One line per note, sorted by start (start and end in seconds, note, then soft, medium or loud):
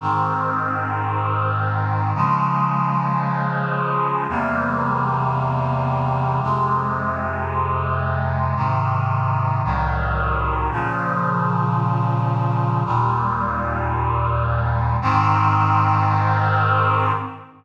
0.01 2.13 G#2 medium
0.01 2.13 D#3 medium
0.01 2.13 C4 medium
2.15 4.27 C#3 medium
2.15 4.27 F3 medium
2.15 4.27 G#3 medium
4.29 6.41 E2 medium
4.29 6.41 C3 medium
4.29 6.41 G3 medium
4.29 6.41 A#3 medium
6.42 8.54 F2 medium
6.42 8.54 C3 medium
6.42 8.54 G#3 medium
8.56 9.62 G#2 medium
8.56 9.62 C3 medium
8.56 9.62 D#3 medium
9.64 10.70 C2 medium
9.64 10.70 A2 medium
9.64 10.70 D#3 medium
9.64 10.70 F#3 medium
10.71 12.83 A#2 medium
10.71 12.83 C#3 medium
10.71 12.83 F3 medium
12.85 14.97 D#2 medium
12.85 14.97 A#2 medium
12.85 14.97 G3 medium
15.02 17.12 G#2 medium
15.02 17.12 D#3 loud
15.02 17.12 C4 medium